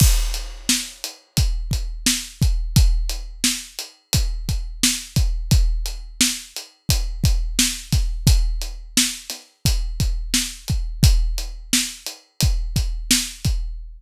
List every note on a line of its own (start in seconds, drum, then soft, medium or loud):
0.00 kick medium
0.00 crash loud
0.34 closed hi-hat medium
0.69 snare loud
1.04 closed hi-hat medium
1.37 kick medium
1.37 closed hi-hat medium
1.71 kick medium
1.71 closed hi-hat medium
2.06 snare loud
2.42 kick medium
2.42 closed hi-hat medium
2.76 kick medium
2.76 closed hi-hat medium
3.09 closed hi-hat medium
3.44 snare loud
3.79 closed hi-hat medium
4.13 kick medium
4.13 closed hi-hat medium
4.49 kick medium
4.49 closed hi-hat medium
4.83 snare loud
5.16 kick medium
5.16 closed hi-hat medium
5.51 kick medium
5.51 closed hi-hat medium
5.86 closed hi-hat medium
6.21 snare loud
6.56 closed hi-hat medium
6.89 kick medium
6.89 closed hi-hat medium
7.24 kick medium
7.24 closed hi-hat medium
7.59 snare loud
7.92 kick medium
7.92 snare soft
7.92 closed hi-hat medium
8.27 kick loud
8.27 closed hi-hat loud
8.61 closed hi-hat medium
8.97 snare loud
9.30 snare soft
9.30 closed hi-hat medium
9.65 kick medium
9.65 closed hi-hat medium
10.00 kick medium
10.00 closed hi-hat medium
10.34 snare medium
10.68 kick medium
10.68 closed hi-hat medium
11.03 kick loud
11.03 closed hi-hat medium
11.38 closed hi-hat medium
11.73 snare loud
12.06 closed hi-hat medium
12.41 kick medium
12.41 closed hi-hat medium
12.76 kick medium
12.76 closed hi-hat medium
13.11 snare loud
13.45 kick medium
13.45 closed hi-hat medium